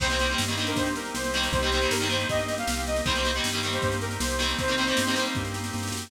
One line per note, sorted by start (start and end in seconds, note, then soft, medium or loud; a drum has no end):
0.00 0.35 C2 medium
0.00 0.07 D#3 medium
0.00 0.07 G3 medium
0.00 0.75 A#3 medium
0.00 1.50 A#3 medium
0.00 0.07 A#3 medium
0.00 0.75 C4 medium
0.00 1.50 C4 medium
0.00 0.07 C4 medium
0.00 0.75 D#4 medium
0.00 1.50 D#4 medium
0.00 0.75 G4 medium
0.00 1.50 G4 medium
0.00 0.36 C5 loud
0.00 kick medium
0.00 snare medium
0.00 crash medium
0.10 0.17 D#3 medium
0.10 0.17 G3 medium
0.10 0.17 A#3 medium
0.10 snare medium
0.14 0.17 C4 medium
0.19 0.28 D#3 medium
0.19 0.28 G3 medium
0.19 0.28 A#3 medium
0.19 snare medium
0.24 0.28 C4 medium
0.30 0.45 D#3 medium
0.30 0.45 G3 medium
0.30 0.45 A#3 medium
0.34 0.45 C4 medium
0.38 0.73 G2 medium
0.38 snare medium
0.48 0.56 D#3 medium
0.48 0.56 G3 medium
0.48 0.56 A#3 medium
0.48 snare medium
0.52 0.56 C4 medium
0.57 0.88 D#3 medium
0.57 0.88 G3 medium
0.57 0.88 A#3 medium
0.57 0.92 D4 medium
0.57 snare medium
0.62 0.88 C4 medium
0.67 0.76 A#4 medium
0.67 snare medium
0.76 1.10 G2 medium
0.76 1.52 A#3 medium
0.76 1.52 C4 medium
0.76 1.52 G4 medium
0.76 1.53 A#4 medium
0.76 0.95 C5 medium
0.76 kick medium
0.76 snare medium
0.86 snare medium
0.96 1.14 A#4 medium
0.96 snare medium
1.05 snare medium
1.14 1.48 C2 medium
1.14 1.48 C5 medium
1.14 snare medium
1.24 snare medium
1.34 1.61 D#3 medium
1.34 1.61 G3 medium
1.34 1.61 A#3 medium
1.34 snare medium
1.38 1.61 C4 medium
1.43 snare medium
1.52 1.87 C2 medium
1.52 3.02 A#3 medium
1.52 2.28 A#3 medium
1.52 3.02 C4 medium
1.52 2.28 C4 medium
1.52 3.02 D#4 medium
1.52 2.28 D#4 medium
1.52 3.02 G4 medium
1.52 2.06 G4 loud
1.52 2.28 G4 medium
1.52 1.90 C5 loud
1.52 kick medium
1.52 snare medium
1.62 1.70 D#3 medium
1.62 1.70 G3 medium
1.62 1.70 A#3 medium
1.62 snare medium
1.67 1.70 C4 medium
1.72 1.80 D#3 medium
1.72 1.80 G3 medium
1.72 1.80 A#3 medium
1.72 snare medium
1.76 1.80 C4 medium
1.82 1.97 D#3 medium
1.82 1.97 G3 medium
1.82 1.97 A#3 medium
1.82 snare medium
1.86 1.97 C4 medium
1.91 2.25 G2 medium
1.91 2.08 A#4 medium
1.91 snare loud
2.00 2.08 D#3 medium
2.00 2.08 G3 medium
2.00 2.08 A#3 medium
2.00 snare medium
2.05 2.08 C4 medium
2.09 2.40 D#3 medium
2.09 2.40 G3 medium
2.09 2.40 A#3 medium
2.09 2.28 C5 medium
2.09 snare medium
2.13 2.40 C4 medium
2.20 snare medium
2.29 2.64 G2 medium
2.29 3.04 A#3 medium
2.29 3.04 C4 medium
2.29 3.04 G4 medium
2.29 3.05 A#4 medium
2.29 2.55 D#5 medium
2.29 kick medium
2.29 snare medium
2.39 snare medium
2.48 snare medium
2.58 2.82 F5 medium
2.58 snare medium
2.67 3.02 C2 medium
2.67 snare loud
2.77 snare medium
2.87 3.04 D#5 medium
2.87 snare medium
2.96 snare medium
3.05 3.40 C2 medium
3.05 3.13 D#3 medium
3.05 3.13 G3 medium
3.05 3.81 A#3 medium
3.05 4.55 A#3 medium
3.05 3.13 A#3 medium
3.05 3.81 C4 medium
3.05 4.55 C4 medium
3.05 3.81 D#4 medium
3.05 4.55 D#4 medium
3.05 3.81 G4 medium
3.05 4.55 G4 medium
3.05 3.37 C5 loud
3.05 kick medium
3.05 snare medium
3.10 3.13 C4 medium
3.15 3.23 D#3 medium
3.15 3.23 G3 medium
3.15 3.23 A#3 medium
3.15 snare medium
3.20 3.23 C4 medium
3.24 3.31 D#3 medium
3.24 3.31 G3 medium
3.24 3.31 A#3 medium
3.24 snare medium
3.28 3.31 C4 medium
3.34 3.51 D#3 medium
3.34 3.51 G3 medium
3.34 3.51 A#3 medium
3.34 snare medium
3.40 3.51 C4 medium
3.44 3.79 G2 medium
3.44 snare medium
3.53 3.61 D#3 medium
3.53 3.61 G3 medium
3.53 3.61 A#3 medium
3.53 snare soft
3.57 3.61 C4 medium
3.63 3.93 D#3 medium
3.63 3.93 G3 medium
3.63 3.93 A#3 medium
3.63 3.97 G4 medium
3.63 snare medium
3.67 3.93 C4 medium
3.73 3.82 C5 medium
3.73 snare medium
3.82 4.18 G2 medium
3.82 4.58 A#3 medium
3.82 4.58 C4 medium
3.82 4.58 G4 medium
3.82 4.58 A#4 medium
3.82 3.98 C5 medium
3.82 kick medium
3.82 snare medium
3.92 snare medium
4.01 4.17 A#4 medium
4.01 snare medium
4.11 snare medium
4.20 4.55 C2 medium
4.20 4.53 C5 medium
4.20 snare loud
4.30 snare medium
4.39 4.66 D#3 medium
4.39 4.66 G3 medium
4.39 4.66 A#3 medium
4.39 snare medium
4.43 4.66 C4 medium
4.49 snare medium
4.58 4.93 C2 medium
4.58 6.08 A#3 medium
4.58 5.34 A#3 medium
4.58 6.08 C4 medium
4.58 5.11 C4 medium
4.58 5.34 C4 medium
4.58 6.08 D#4 medium
4.58 5.36 D#4 medium
4.58 6.08 G4 medium
4.58 5.34 G4 medium
4.58 5.25 C5 loud
4.58 kick medium
4.58 snare medium
4.68 4.75 D#3 medium
4.68 4.75 G3 medium
4.68 4.75 A#3 medium
4.68 snare medium
4.72 4.75 C4 medium
4.78 4.86 D#3 medium
4.78 4.86 G3 medium
4.78 4.86 A#3 medium
4.78 snare medium
4.82 4.86 C4 medium
4.87 5.02 D#3 medium
4.87 5.02 G3 medium
4.87 5.02 A#3 medium
4.87 snare medium
4.91 5.02 C4 medium
4.97 5.32 G2 medium
4.97 snare loud
5.06 5.15 D#3 medium
5.06 5.15 G3 medium
5.06 5.15 A#3 medium
5.06 snare medium
5.11 5.46 D#3 medium
5.11 5.15 C4 medium
5.11 5.34 C4 medium
5.16 5.46 G3 medium
5.16 5.46 A#3 medium
5.16 5.46 C4 medium
5.16 snare medium
5.25 snare medium
5.35 5.71 G2 medium
5.35 6.10 A#3 medium
5.35 6.10 C4 medium
5.35 6.10 G4 medium
5.35 6.10 A#4 medium
5.35 kick medium
5.35 snare medium
5.45 snare medium
5.54 snare medium
5.64 snare medium
5.73 5.91 G2 medium
5.73 snare medium
5.78 snare medium
5.83 snare medium
5.88 snare medium
5.92 6.09 F#2 medium
5.92 snare medium
5.97 snare medium
6.02 snare medium
6.07 snare medium